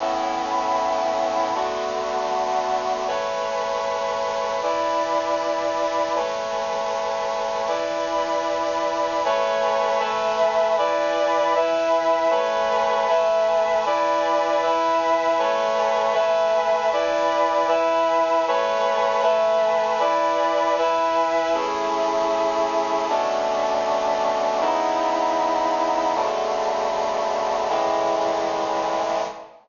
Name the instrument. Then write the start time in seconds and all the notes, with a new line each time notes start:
brass section
0.00 A2 B3 C#4 E4
1.55 D3 A3 B3 F#4
3.07 A3 B4 C#5 G#5
4.62 E4 B4 D5 G#5
6.15 A3 B4 C#5 G#5
7.68 E4 B4 D5 G#5
9.25 A3 B4 C#5 G#5
9.99 A3 B4 E5 G#5
10.78 E4 B4 D5 G#5
11.55 E4 B4 E5 G#5
12.30 A3 B4 C#5 G#5
13.08 A3 B4 E5 G#5
13.86 E4 B4 D5 G#5
14.62 E4 B4 E5 G#5
15.38 A3 B4 C#5 G#5
16.14 A3 B4 E5 G#5
16.92 E4 B4 D5 G#5
17.68 E4 B4 E5 G#5
18.48 A3 B4 C#5 G#5
19.22 A3 B4 E5 G#5
20.00 E4 B4 D5 G#5
20.78 E4 B4 E5 G#5
21.54 A3 C#4 E4 G#4
23.09 B2 A3 C#4 D4
24.61 C#3 B3 D#4 E4
26.15 B2 C#3 D3 A3
27.69 A2 C#3 E3 G#3